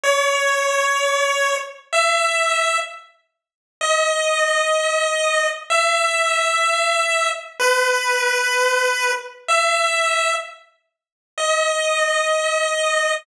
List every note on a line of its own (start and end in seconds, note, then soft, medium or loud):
0.03 1.55 C#5 loud
1.93 2.78 E5 loud
3.81 5.47 D#5 loud
5.70 7.30 E5 loud
7.60 9.11 B4 loud
9.48 10.34 E5 loud
11.38 13.13 D#5 medium